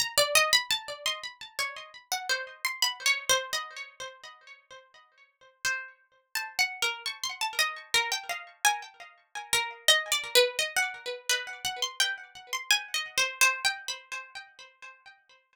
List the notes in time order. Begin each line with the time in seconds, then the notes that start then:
0.00 A#5
0.18 D5
0.35 D#5
0.53 B5
0.71 A5
1.06 C6
1.59 C#5
2.12 F#5
2.29 C5
2.65 C6
2.82 B5
3.06 C#5
3.29 C5
3.53 D#5
5.65 C5
6.35 A5
6.59 F#5
6.82 A#4
7.06 C#6
7.24 C6
7.41 A5
7.59 D#5
7.94 A#4
8.12 G5
8.29 F5
8.65 G#5
9.53 A#4
9.88 D#5
10.12 D5
10.35 B4
10.59 D#5
10.76 F#5
11.29 B4
11.65 F#5
11.82 C6
12.00 G5
12.53 C6
12.71 G#5
12.94 D#5
13.18 C5
13.41 C5
13.65 G5
13.88 B5